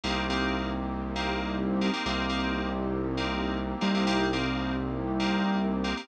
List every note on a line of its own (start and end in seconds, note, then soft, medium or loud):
0.04 1.90 C2 medium
0.04 0.24 A#3 medium
0.04 2.04 A#3 loud
0.04 0.24 C4 medium
0.04 2.04 C4 medium
0.04 0.24 D#4 medium
0.04 2.04 D#4 loud
0.04 0.24 G4 medium
0.04 2.04 G4 loud
0.30 0.70 A#3 medium
0.30 0.70 C4 medium
0.30 0.70 D#4 medium
0.30 0.70 G4 medium
1.16 1.56 A#3 medium
1.16 1.56 C4 medium
1.16 1.56 D#4 medium
1.16 1.56 G4 medium
1.81 1.91 A#3 medium
1.81 1.91 C4 medium
1.81 1.91 D#4 medium
1.81 1.91 G4 medium
1.93 2.03 A#3 medium
1.93 2.03 C4 medium
1.93 2.03 D#4 medium
1.93 2.03 G4 medium
2.06 3.74 C2 medium
2.06 2.26 A#3 loud
2.06 4.06 A#3 loud
2.06 2.26 C4 medium
2.06 4.06 C4 loud
2.06 2.26 D#4 medium
2.06 4.06 D#4 medium
2.06 2.26 G4 medium
2.06 4.06 G4 medium
2.29 2.70 A#3 medium
2.29 2.70 C4 medium
2.29 2.70 D#4 medium
2.29 2.70 G4 medium
3.17 3.58 A#3 medium
3.17 3.58 C4 medium
3.17 3.58 D#4 medium
3.17 3.58 G4 medium
3.81 5.93 C2 medium
3.81 3.91 A#3 medium
3.81 3.91 C4 medium
3.81 3.91 D#4 medium
3.81 3.91 G4 medium
3.94 4.04 A#3 medium
3.94 4.04 C4 medium
3.94 4.04 D#4 medium
3.94 4.04 G4 medium
4.06 6.06 A#3 loud
4.06 4.27 A#3 medium
4.06 6.06 C4 medium
4.06 4.27 C4 medium
4.06 6.06 D#4 medium
4.06 4.27 D#4 medium
4.06 6.06 G4 medium
4.06 4.27 G4 loud
4.33 4.73 A#3 medium
4.33 4.73 C4 medium
4.33 4.73 D#4 medium
4.33 4.73 G4 medium
5.20 5.60 A#3 medium
5.20 5.60 C4 medium
5.20 5.60 D#4 medium
5.20 5.60 G4 medium
5.84 5.94 A#3 medium
5.84 5.94 C4 medium
5.84 5.94 D#4 medium
5.84 5.94 G4 medium
5.97 6.07 A#3 medium
5.97 6.07 C4 medium
5.97 6.07 D#4 medium
5.97 6.07 G4 medium